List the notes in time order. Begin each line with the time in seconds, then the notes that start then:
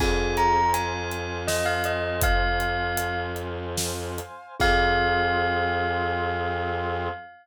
0.00 F2 C4 F4 G#4 C5 F5 G#5, kick, crash
0.37 A#5, closed hi-hat
0.74 G#5, closed hi-hat
1.11 closed hi-hat
1.48 D#5, snare
1.66 F5
1.84 D#5, closed hi-hat
2.21 F5, kick, closed hi-hat
2.60 closed hi-hat
2.97 closed hi-hat
3.36 closed hi-hat
3.77 snare
4.18 closed hi-hat
4.60 F2 C4 F4 G#4 F5, kick, crash